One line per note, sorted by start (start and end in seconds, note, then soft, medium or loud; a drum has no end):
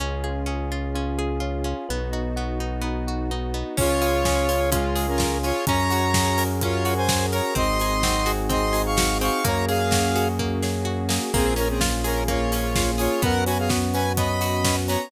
0.00 1.74 C#2 medium
0.00 0.46 C#4 loud
0.00 0.70 C#4 medium
0.00 1.87 C#4 medium
0.00 1.87 F4 medium
0.00 1.87 G#4 medium
0.24 0.94 F4 medium
0.24 1.18 G#4 medium
0.46 0.95 C#4 medium
0.46 1.18 G#4 medium
0.71 1.41 C#4 medium
0.71 1.40 F4 medium
0.94 1.64 C#4 medium
0.94 1.65 F4 medium
1.18 1.85 G#4 medium
1.18 1.86 G#4 medium
1.40 1.87 C#4 medium
1.40 1.85 F4 medium
1.64 1.87 C#4 medium
1.64 1.88 F4 medium
1.89 3.64 B1 medium
1.89 2.59 B3 medium
1.89 3.76 B3 medium
1.89 2.37 B3 medium
1.89 3.76 D#4 medium
1.89 3.76 F#4 medium
2.13 2.83 D#4 medium
2.13 3.08 F#4 medium
2.36 2.81 B3 medium
2.36 3.07 F#4 medium
2.60 3.30 B3 medium
2.60 3.31 D#4 medium
2.81 3.53 B3 medium
2.81 3.54 D#4 medium
3.07 3.75 F#4 medium
3.31 3.76 B3 medium
3.31 3.76 D#4 medium
3.54 3.76 B3 medium
3.54 3.77 D#4 medium
3.77 5.52 C#2 medium
3.77 4.25 C#4 loud
3.77 4.48 C#4 medium
3.77 5.65 C#4 medium
3.77 5.65 F4 medium
3.77 4.70 F4 loud
3.77 5.65 G#4 medium
3.77 4.70 C#5 loud
3.77 kick medium
3.77 crash medium
4.02 4.72 F4 medium
4.02 4.95 G#4 medium
4.02 open hi-hat medium
4.25 4.71 C#4 medium
4.25 4.96 G#4 medium
4.25 kick medium
4.25 snare medium
4.49 5.19 C#4 medium
4.49 5.17 F4 medium
4.49 open hi-hat medium
4.72 5.07 G#3 medium
4.72 5.44 C#4 medium
4.72 5.43 F4 medium
4.72 5.07 F4 medium
4.72 kick medium
4.72 closed hi-hat loud
4.95 5.63 G#4 medium
4.95 open hi-hat medium
5.08 5.38 C#4 medium
5.08 5.38 A#4 medium
5.18 5.65 C#4 medium
5.18 5.63 F4 medium
5.18 kick medium
5.18 snare medium
5.43 5.67 C#4 medium
5.43 5.66 F4 medium
5.43 5.65 F4 medium
5.43 5.65 C#5 loud
5.43 open hi-hat medium
5.67 7.41 F#2 medium
5.67 6.61 C#4 medium
5.67 7.54 C#4 medium
5.67 6.62 C#4 loud
5.67 7.54 F#4 medium
5.67 7.54 G#4 medium
5.67 7.54 A#4 medium
5.67 6.44 C#5 loud
5.67 6.44 A#5 loud
5.67 kick medium
5.67 closed hi-hat medium
5.90 6.85 F#4 medium
5.90 open hi-hat medium
6.14 7.08 G#4 medium
6.14 7.09 G#4 medium
6.14 kick medium
6.14 snare loud
6.38 7.32 A#4 medium
6.38 open hi-hat medium
6.61 7.51 C#4 medium
6.61 7.52 C#4 medium
6.61 6.94 F4 medium
6.61 6.94 C#5 loud
6.61 kick medium
6.61 closed hi-hat medium
6.85 7.52 F#4 medium
6.85 7.53 F#4 medium
6.85 open hi-hat medium
6.97 7.26 C5 medium
6.97 7.26 G#5 loud
7.09 7.54 G#4 medium
7.09 7.55 G#4 medium
7.09 kick medium
7.09 snare loud
7.32 7.55 A#4 medium
7.32 7.54 C#5 medium
7.32 7.54 A#5 medium
7.32 open hi-hat medium
7.55 9.30 G#1 medium
7.55 8.03 C4 loud
7.55 8.50 C4 medium
7.55 9.43 C4 medium
7.55 9.43 D#4 medium
7.55 9.43 F#4 medium
7.55 9.43 G#4 medium
7.55 8.32 D#5 loud
7.55 8.32 C6 loud
7.55 kick medium
7.55 closed hi-hat medium
7.80 8.74 D#4 medium
7.80 8.72 G#4 medium
7.80 open hi-hat medium
8.03 8.49 C4 medium
8.03 8.97 F#4 medium
8.03 kick medium
8.03 snare medium
8.26 8.96 F#4 loud
8.26 9.21 G#4 medium
8.26 open hi-hat medium
8.49 9.21 C4 loud
8.49 9.40 C4 medium
8.49 8.82 D#5 medium
8.49 8.82 C6 loud
8.49 kick medium
8.49 closed hi-hat medium
8.73 9.41 D#4 medium
8.73 9.40 G#4 medium
8.73 open hi-hat medium
8.86 9.18 F5 medium
8.86 9.18 C#6 medium
8.97 9.42 F#4 medium
8.97 9.43 F#4 medium
8.97 kick medium
8.97 snare loud
9.21 9.44 C4 medium
9.21 9.44 G#4 medium
9.21 9.44 F5 medium
9.21 9.44 C#6 loud
9.21 open hi-hat medium
9.44 11.19 F#2 medium
9.44 9.90 A#3 loud
9.44 11.32 A#3 medium
9.44 10.39 A#3 loud
9.44 11.32 C#4 medium
9.44 11.32 F#4 medium
9.44 11.32 G#4 medium
9.44 9.65 C#5 medium
9.44 9.65 A#5 loud
9.44 kick medium
9.44 closed hi-hat medium
9.68 10.62 C#4 medium
9.68 10.28 G#4 medium
9.68 10.62 G#4 medium
9.68 10.28 F5 loud
9.68 open hi-hat medium
9.91 10.39 A#3 medium
9.91 10.86 F#4 medium
9.91 kick medium
9.91 snare medium
10.16 10.84 F#4 medium
10.16 11.10 G#4 medium
10.16 open hi-hat medium
10.39 11.08 A#3 medium
10.39 11.29 A#3 medium
10.39 kick medium
10.63 11.30 C#4 medium
10.63 11.30 G#4 medium
10.63 snare medium
10.85 11.30 F#4 medium
10.85 11.32 F#4 medium
11.09 11.31 A#3 medium
11.09 11.32 G#4 medium
11.09 snare medium
11.34 13.08 A#1 medium
11.34 12.28 A#3 medium
11.34 12.28 A#3 loud
11.34 13.21 A#3 medium
11.34 11.54 C4 loud
11.34 13.21 C#4 medium
11.34 13.21 F4 medium
11.34 11.54 G#4 loud
11.34 13.21 G#4 medium
11.34 kick medium
11.34 crash medium
11.56 12.52 C#4 medium
11.56 11.68 C#4 medium
11.56 12.51 C#4 medium
11.56 11.68 A#4 loud
11.56 open hi-hat medium
11.69 11.80 C4 medium
11.69 11.80 G#4 medium
11.81 12.75 F4 medium
11.81 kick medium
11.81 snare medium
12.04 12.24 C#4 medium
12.04 12.98 G#4 medium
12.04 12.99 G#4 medium
12.04 12.24 A#4 loud
12.04 open hi-hat medium
12.28 13.18 A#3 medium
12.28 12.91 F4 medium
12.28 12.91 C#5 medium
12.28 kick medium
12.28 closed hi-hat medium
12.52 13.19 C#4 medium
12.52 13.20 C#4 medium
12.52 open hi-hat medium
12.75 13.20 F4 medium
12.75 13.21 F4 medium
12.75 kick medium
12.75 snare medium
12.98 13.22 F4 medium
12.98 13.20 G#4 medium
12.98 13.22 G#4 medium
12.98 13.22 C#5 medium
12.98 open hi-hat medium
13.22 14.97 F#2 medium
13.22 13.69 B3 loud
13.22 13.93 B3 loud
13.22 15.10 B3 medium
13.22 15.10 C#4 medium
13.22 15.10 F#4 medium
13.22 13.44 A#4 loud
13.22 13.44 F#5 loud
13.22 kick medium
13.22 closed hi-hat medium
13.46 14.17 C#4 medium
13.46 14.41 F#4 medium
13.46 13.58 B4 medium
13.46 13.58 G#5 medium
13.46 open hi-hat medium
13.58 13.70 G#4 medium
13.58 13.70 F5 medium
13.69 14.17 B3 medium
13.69 14.40 F#4 medium
13.69 kick medium
13.69 snare medium
13.94 14.64 B3 medium
13.94 14.64 C#4 medium
13.94 14.13 B4 medium
13.94 14.13 G#5 loud
13.94 open hi-hat medium
14.17 14.89 B3 medium
14.17 14.88 C#4 medium
14.17 14.76 D#5 medium
14.17 14.76 B5 medium
14.17 kick medium
14.17 closed hi-hat medium
14.41 15.08 F#4 medium
14.41 15.09 F#4 medium
14.41 open hi-hat medium
14.65 15.09 B3 medium
14.65 15.09 C#4 medium
14.65 kick medium
14.65 snare medium
14.88 15.11 B3 medium
14.88 15.11 C#4 medium
14.88 15.09 C#5 medium
14.88 15.09 A#5 medium
14.88 open hi-hat medium